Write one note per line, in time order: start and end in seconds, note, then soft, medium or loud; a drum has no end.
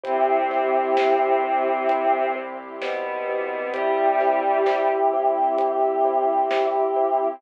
0.04 6.84 C2 loud
0.04 2.38 C3 medium
0.04 7.36 C4 medium
0.04 2.38 C4 medium
0.04 0.22 E4 medium
0.04 2.26 E4 medium
0.04 7.36 E4 medium
0.04 0.22 G4 loud
0.04 2.26 G4 loud
0.04 7.36 G4 loud
0.04 0.22 C5 medium
0.04 kick loud
0.04 closed hi-hat loud
0.51 0.69 E4 medium
0.51 0.69 G4 medium
0.51 0.69 C5 medium
0.51 snare medium
0.97 1.16 E4 medium
0.97 1.16 G4 medium
0.97 1.16 C5 medium
0.97 snare loud
1.44 1.62 E4 medium
1.44 1.62 G4 medium
1.44 1.62 C5 medium
1.89 2.08 E4 medium
1.89 2.08 G4 medium
1.89 2.08 C5 medium
1.89 closed hi-hat loud
2.35 2.54 E4 medium
2.35 2.54 G4 medium
2.35 2.54 C5 medium
2.81 3.71 B2 medium
2.81 3.71 B3 medium
2.81 3.01 E4 medium
2.81 3.01 G4 medium
2.81 3.01 C5 loud
2.81 snare loud
3.27 3.46 E4 medium
3.27 3.46 G4 medium
3.27 3.46 C5 medium
3.73 4.89 G3 medium
3.73 7.29 E4 medium
3.73 3.92 E4 medium
3.73 7.29 G4 loud
3.73 4.89 G4 medium
3.73 3.92 G4 medium
3.73 3.92 C5 medium
3.73 kick loud
3.73 closed hi-hat loud
4.20 4.39 E4 medium
4.20 4.39 G4 medium
4.20 4.39 C5 medium
4.20 snare medium
4.66 4.85 E4 medium
4.66 4.85 G4 medium
4.66 4.85 C5 medium
4.66 snare loud
5.13 5.32 E4 medium
5.13 5.32 G4 medium
5.13 5.32 C5 medium
5.58 5.77 E4 medium
5.58 5.77 G4 medium
5.58 5.77 C5 medium
5.58 closed hi-hat loud
6.05 6.23 E4 medium
6.05 6.23 G4 medium
6.05 6.23 C5 medium
6.51 6.69 E4 medium
6.51 6.69 G4 medium
6.51 6.69 C5 medium
6.51 snare loud
6.96 7.15 E4 medium
6.96 7.15 G4 medium
6.96 7.15 C5 medium